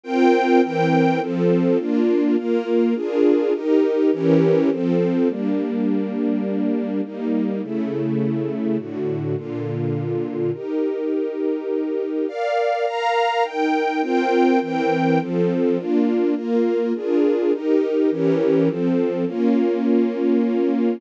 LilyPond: \new Staff { \time 3/4 \key bes \major \tempo 4 = 103 <c' f' bes' g''>4 <e c' bes' g''>4 <f c' a'>4 | <bes d' f'>4 <bes f' bes'>4 <d' f' aes' bes'>4 | <ees' g' bes'>4 <e des' g' bes'>4 <f c' a'>4 | \key g \minor <g bes d'>2. |
<g bes ees'>4 <cis a e'>2 | <a, d fis'>4 <bes, d f'>2 | <ees' g' bes'>2. | \key bes \major <bes' d'' f''>4 <bes' f'' bes''>4 <ees' bes' g''>4 |
<c' f' bes' g''>4 <e c' bes' g''>4 <f c' a'>4 | <bes d' f'>4 <bes f' bes'>4 <d' f' aes' bes'>4 | <ees' g' bes'>4 <e des' g' bes'>4 <f c' a'>4 | \key bes \minor <bes des' f'>2. | }